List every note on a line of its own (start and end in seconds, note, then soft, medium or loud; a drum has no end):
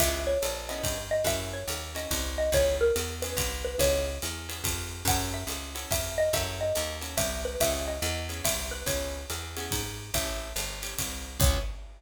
0.00 0.37 C#2 medium
0.00 0.32 B3 loud
0.00 0.32 C#4 medium
0.00 0.32 E4 medium
0.00 0.32 G#4 medium
0.00 0.21 E5 loud
0.00 kick medium
0.00 crash loud
0.00 ride loud
0.27 0.61 C#5 medium
0.42 0.82 A#1 medium
0.42 hi-hat pedal medium
0.42 ride medium
0.69 0.96 B3 medium
0.69 0.96 C#4 medium
0.69 0.96 E4 medium
0.69 0.96 G#4 medium
0.69 1.02 D#5 medium
0.69 ride medium
0.83 1.23 G2 medium
0.83 kick medium
0.83 ride medium
1.11 1.25 D#5 medium
1.24 1.64 F#2 medium
1.24 1.59 C#4 medium
1.24 1.59 E4 loud
1.24 1.59 F#4 medium
1.24 1.59 A4 medium
1.24 1.51 E5 loud
1.24 kick medium
1.24 ride loud
1.53 1.90 C#5 medium
1.68 2.07 D#2 medium
1.68 hi-hat pedal medium
1.68 ride medium
1.95 2.21 C#4 medium
1.95 2.21 E4 medium
1.95 2.21 F#4 medium
1.95 2.21 A4 medium
1.95 2.30 D#5 medium
1.95 ride medium
2.11 2.50 C2 medium
2.11 kick medium
2.11 ride loud
2.38 2.52 D#5 medium
2.52 2.91 C#2 medium
2.52 2.87 B3 medium
2.52 2.87 C#4 medium
2.52 2.87 E4 medium
2.52 2.87 G#4 medium
2.52 2.76 C#5 loud
2.52 kick medium
2.52 ride medium
2.81 3.15 A#4 medium
2.96 3.35 E2 medium
2.96 hi-hat pedal medium
2.96 ride medium
3.22 3.50 B3 medium
3.22 3.50 C#4 medium
3.22 3.50 E4 medium
3.22 3.50 G#4 medium
3.22 3.59 B4 medium
3.22 ride medium
3.37 3.76 C2 medium
3.37 kick medium
3.37 ride loud
3.65 3.78 B4 medium
3.78 4.18 C#2 medium
3.78 4.11 B3 medium
3.78 4.11 C#4 medium
3.78 4.11 E4 medium
3.78 4.11 G#4 loud
3.78 4.57 C#5 medium
3.78 kick medium
3.78 ride loud
4.22 4.62 E2 medium
4.22 hi-hat pedal medium
4.22 ride medium
4.49 4.75 B3 medium
4.49 4.75 C#4 medium
4.49 4.75 E4 medium
4.49 4.75 G#4 medium
4.49 ride medium
4.64 5.03 F2 medium
4.64 kick medium
4.64 ride loud
5.05 5.44 F#2 loud
5.05 5.41 C#4 medium
5.05 5.41 E4 loud
5.05 5.41 F#4 medium
5.05 5.41 A4 medium
5.05 5.34 F#5 loud
5.05 kick medium
5.05 ride loud
5.34 5.68 E5 medium
5.47 5.86 C#2 medium
5.47 hi-hat pedal medium
5.47 ride medium
5.75 6.01 C#4 medium
5.75 6.01 E4 medium
5.75 6.01 F#4 medium
5.75 6.01 A4 medium
5.75 ride medium
5.91 6.30 F2 medium
5.91 6.18 E5 medium
5.91 kick medium
5.91 ride loud
6.18 6.33 D#5 medium
6.33 6.72 F#2 loud
6.33 6.66 C#4 medium
6.33 6.66 E4 medium
6.33 6.66 F#4 medium
6.33 6.66 A4 loud
6.33 6.60 E5 medium
6.33 kick medium
6.33 ride medium
6.61 6.96 D#5 medium
6.75 7.16 D#2 medium
6.75 hi-hat pedal medium
6.75 ride medium
7.01 7.27 C#4 medium
7.01 7.27 E4 medium
7.01 7.27 F#4 medium
7.01 7.27 A4 medium
7.01 ride medium
7.17 7.56 C2 medium
7.17 7.39 E5 medium
7.17 kick medium
7.17 ride loud
7.45 7.60 B4 medium
7.60 7.99 C#2 medium
7.60 7.96 B3 medium
7.60 7.96 C#4 loud
7.60 7.96 E4 medium
7.60 7.96 G#4 medium
7.60 7.83 E5 loud
7.60 kick medium
7.60 ride loud
7.88 8.25 D#5 medium
8.02 8.41 E2 loud
8.02 hi-hat pedal medium
8.02 ride medium
8.29 8.55 B3 medium
8.29 8.55 C#4 medium
8.29 8.55 E4 medium
8.29 8.55 G#4 medium
8.29 ride medium
8.44 8.83 C2 medium
8.44 8.71 E5 medium
8.44 kick medium
8.44 ride loud
8.71 8.85 B4 medium
8.86 9.25 C#2 medium
8.86 9.19 B3 medium
8.86 9.19 C#4 medium
8.86 9.19 E4 loud
8.86 9.19 G#4 medium
8.86 9.45 C#5 medium
8.86 kick medium
8.86 ride loud
9.30 9.69 E2 medium
9.30 hi-hat pedal medium
9.30 ride medium
9.57 9.83 B3 medium
9.57 9.83 C#4 medium
9.57 9.83 E4 medium
9.57 9.83 G#4 medium
9.57 ride medium
9.71 10.11 G#2 medium
9.71 kick medium
9.71 ride loud
10.14 10.53 A1 medium
10.14 10.48 C#4 medium
10.14 10.48 E4 medium
10.14 10.48 G4 loud
10.14 10.48 A4 medium
10.14 10.79 E5 medium
10.14 kick medium
10.14 ride loud
10.56 10.95 G1 medium
10.56 hi-hat pedal medium
10.56 ride medium
10.82 11.08 C#4 medium
10.82 11.08 E4 medium
10.82 11.08 G4 medium
10.82 11.08 A4 medium
10.82 ride medium
10.99 11.38 C2 medium
10.99 kick medium
10.99 ride loud
11.40 11.58 C#2 loud
11.40 11.61 B3 medium
11.40 11.61 C#4 loud
11.40 11.61 E4 medium
11.40 11.61 G#4 loud
11.40 11.60 C#5 loud
11.40 kick loud
11.40 crash loud